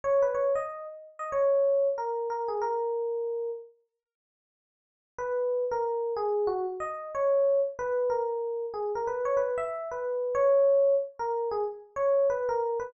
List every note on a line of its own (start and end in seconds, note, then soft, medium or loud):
0.04 0.22 C#5 medium
0.22 0.35 B4 medium
0.35 0.53 C#5 medium
0.56 0.85 D#5 medium
1.19 1.31 D#5 medium
1.32 1.87 C#5 medium
1.98 2.28 A#4 medium
2.30 2.48 A#4 medium
2.48 2.61 G#4 medium
2.62 3.50 A#4 medium
5.18 5.65 B4 medium
5.71 6.14 A#4 medium
6.17 6.47 G#4 medium
6.47 6.65 F#4 medium
6.80 7.09 D#5 medium
7.15 7.60 C#5 medium
7.79 8.10 B4 medium
8.10 8.65 A#4 medium
8.74 8.92 G#4 medium
8.95 9.08 A#4 medium
9.07 9.26 B4 medium
9.25 9.37 C#5 medium
9.37 9.55 B4 medium
9.58 9.88 E5 medium
9.91 10.35 B4 medium
10.35 10.94 C#5 medium
11.19 11.49 A#4 medium
11.51 11.64 G#4 medium
11.96 12.27 C#5 medium
12.30 12.48 B4 medium
12.49 12.78 A#4 medium
12.80 12.92 B4 medium